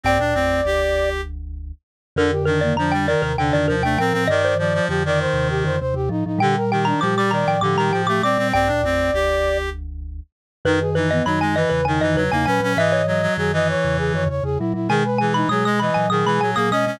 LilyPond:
<<
  \new Staff \with { instrumentName = "Xylophone" } { \time 7/8 \key g \minor \tempo 4 = 99 g''4 r2 r8 | bes'8 bes'16 d''16 bes''16 g''16 d''16 bes'16 g''16 d''16 bes'16 g''16 g''16 r16 | ees''16 c''2~ c''8. r8 | g''8 g''16 bes''16 d'''16 d'''16 bes''16 g''16 d'''16 bes''16 g''16 d'''16 d'''16 r16 |
g''4 r2 r8 | \key gis \minor b'8 b'16 dis''16 b''16 gis''16 dis''16 b'16 gis''16 dis''16 b'16 gis''16 gis''16 r16 | e''16 cis''2~ cis''8. r8 | gis''8 gis''16 b''16 dis'''16 dis'''16 b''16 gis''16 dis'''16 b''16 gis''16 dis'''16 dis'''16 r16 | }
  \new Staff \with { instrumentName = "Flute" } { \time 7/8 \key g \minor d''2 r4. | d'16 g'16 d'16 bes16 d'8 bes'8 d'8. d'16 bes'8 | d''8 d''8 g'16 d''16 c''8 g'16 c''16 c''16 g'16 ees'16 ees'16 | g'16 bes'16 g'16 d'16 g'8 d''8 g'8. g'16 d''8 |
d''2 r4. | \key gis \minor dis'16 gis'16 dis'16 b16 dis'8 b'8 dis'8. dis'16 b'8 | dis''8 dis''8 gis'16 dis''16 cis''8 gis'16 cis''16 cis''16 gis'16 e'16 e'16 | gis'16 b'16 gis'16 dis'16 gis'8 dis''8 gis'8. gis'16 dis''8 | }
  \new Staff \with { instrumentName = "Clarinet" } { \time 7/8 \key g \minor c'16 d'16 c'8 g'4 r4. | d16 r16 ees8 f16 g16 ees8 d16 ees16 f16 a16 c'16 c'16 | ees8 f16 f16 f16 ees4~ ees16 r4 | d16 r16 ees8 f16 g16 ees8 d16 ees16 f16 a16 c'16 c'16 |
c'16 d'16 c'8 g'4 r4. | \key gis \minor dis16 r16 e8 fis16 gis16 e8 dis16 e16 fis16 ais16 cis'16 cis'16 | e8 fis16 fis16 fis16 e4~ e16 r4 | dis16 r16 e8 fis16 gis16 e8 dis16 e16 fis16 ais16 cis'16 cis'16 | }
  \new Staff \with { instrumentName = "Vibraphone" } { \clef bass \time 7/8 \key g \minor <bes,, g,>16 <d, bes,>16 <a,, f,>8 <f,, d,>2 r8 | <f, d>4 <f, d>8. <ees, c>16 <ees, c>16 <f, d>16 <ees, c>16 <ees, c>16 <a, f>16 <a, f>16 | <g, ees>4 <f, d>8. <ees, c>16 <ees, c>16 <f, d>16 <ees, c>16 <ees, c>16 <a, f>16 <a, f>16 | <bes, g>4 <bes, g>8. <a, f>16 <a, f>16 <bes, g>16 <a, f>16 <a, f>16 <bes, g>16 <bes, g>16 |
<bes,, g,>16 <d, bes,>16 <a,, f,>8 <f,, d,>2 r8 | \key gis \minor <fis, dis>4 <fis, dis>8. <e, cis>16 <e, cis>16 <fis, dis>16 <e, cis>16 <e, cis>16 <ais, fis>16 <ais, fis>16 | <gis, e>4 <fis, dis>8. <e, cis>16 <e, cis>16 <fis, dis>16 <e, cis>16 <e, cis>16 <ais, fis>16 <ais, fis>16 | <b, gis>4 <b, gis>8. <ais, fis>16 <ais, fis>16 <b, gis>16 <ais, fis>16 <ais, fis>16 <b, gis>16 <b, gis>16 | }
>>